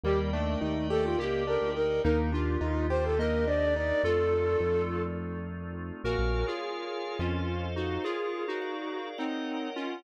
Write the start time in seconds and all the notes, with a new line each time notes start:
0.04 D#2 G3 A#3 G4 A#4 D5 D#5 G5
0.33 A3 D4
0.61 D#2 D#4
0.90 G4 A4
1.04 F4
1.19 C#2 A#3 G4
1.47 D4 A#4
1.61 D2
1.76 D#4 A#4
2.04 D#2 A#3 D4 D#4 G4 A#4
2.32 D4 F4
2.61 D#2 D#4
2.90 G4 C5
3.04 A4
3.19 A#3 A#4 D#5
3.47 D4 D5
3.76 D#4 D5
4.03 F2 A3 C4 D#4 F4 A4
4.60 F2
6.04 A#1 F#4 A#4 C#5 F5 G#5
6.19 A#1
6.47 F4 G#4
7.19 F2 C#4 F4 A4 C5 D#5 F5
7.76 D#4 F#4
8.04 F4 G#4 A#4 C#5 F5
8.48 D#4 F#4
8.62 G#4 A#4 D5 F5
9.18 C4 D#4 A#4 C#5 D#5 F#5
9.76 C#4 F4